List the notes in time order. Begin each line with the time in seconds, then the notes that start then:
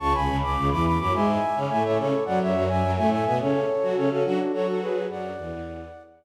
0.00 C#2 C#3 A5 C#6
0.13 C#2 C#3 G#5 B5
0.28 C#2 C#3
0.42 C#2 C#3 B5 D6
0.57 C#2 C#3
0.71 E2 E3 B5 D6
0.85 B5 D6
0.99 F#2 F#3 B5 D6
1.13 G#2 G#3 E5 G#5
1.56 C#3 C#4
1.70 A2 A3 E5 G#5
1.84 A2 A3 C#5 E5
1.98 C#3 C#4 A4 C#5
2.25 F#2 F#3 D5 F#5
2.41 F#2 F#3 C#5 E5
2.55 F#2 F#3
2.69 F#2 F#3 E5 G#5
2.83 F#2 F#3
2.96 A2 A3 E5 G#5
3.11 E5 G#5
3.25 B2 B3 E5 G#5
3.40 C#3 C#4 A4 C#5
3.82 F#3 F#4
3.95 C#3 C#4 A4 C#5
4.10 C#3 C#4 F#4 A4
4.25 F#3 D4 F#4
4.53 F#3 F#4 A4 C#5
4.67 F#4 A4
4.81 G#4 B4
5.09 F#2 F#3 D5 F#5
5.38 E2 E3
5.52 E2 E3